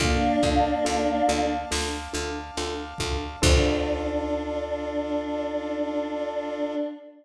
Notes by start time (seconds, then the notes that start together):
0.00 D2 A#3 D4 F4 A4 D5 F5 A5, kick, closed hi-hat
0.43 D2 D4 F4 A4, kick, closed hi-hat
0.85 D2 D4 F4 A4, closed hi-hat
1.28 D2 D4 F4 A4, closed hi-hat
1.71 D2 D4 F4 A4, snare
2.13 D2 D4 F4 A4, closed hi-hat
2.57 D2 D4 F4 A4, closed hi-hat
2.98 D2 D4 F4 A4, kick, closed hi-hat
3.42 D2 D4 F4 A4, kick, crash